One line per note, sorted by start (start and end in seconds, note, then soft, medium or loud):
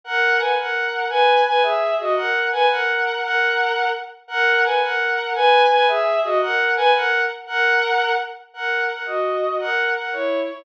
0.04 0.38 A#4 loud
0.04 0.38 F#5 loud
0.38 0.54 B4 medium
0.38 0.54 G#5 medium
0.57 1.05 A#4 medium
0.57 1.05 F#5 loud
1.09 1.40 B4 loud
1.09 1.40 G#5 loud
1.46 1.62 B4 loud
1.46 1.62 G#5 loud
1.62 1.94 G#4 loud
1.62 1.94 E5 loud
1.99 2.14 F#4 medium
1.99 2.14 D#5 loud
2.15 2.46 A#4 loud
2.15 2.46 F#5 loud
2.52 2.66 B4 loud
2.52 2.66 G#5 loud
2.69 3.19 A#4 loud
2.69 3.19 F#5 loud
3.22 3.86 A#4 loud
3.22 3.86 F#5 loud
4.28 4.61 A#4 loud
4.28 4.61 F#5 loud
4.64 4.80 B4 medium
4.64 4.80 G#5 medium
4.82 5.30 A#4 loud
4.82 5.30 F#5 loud
5.35 5.66 B4 loud
5.35 5.66 G#5 loud
5.69 5.85 B4 loud
5.69 5.85 G#5 loud
5.87 6.19 G#4 loud
5.87 6.19 E5 loud
6.23 6.38 F#4 loud
6.23 6.38 D#5 loud
6.41 6.71 A#4 loud
6.41 6.71 F#5 loud
6.76 6.90 B4 loud
6.76 6.90 G#5 loud
6.94 7.20 A#4 loud
6.94 7.20 F#5 loud
7.46 8.11 A#4 loud
7.46 8.11 F#5 loud
8.54 8.84 A#4 loud
8.54 8.84 F#5 loud
8.89 9.03 A#4 medium
8.89 9.03 F#5 medium
9.06 9.56 F#4 medium
9.06 9.56 D#5 medium
9.59 9.89 A#4 loud
9.59 9.89 F#5 loud
9.95 10.10 A#4 medium
9.95 10.10 F#5 medium
10.13 10.43 E4 medium
10.13 10.43 C#5 loud
10.48 10.62 E4 medium
10.48 10.62 C#5 medium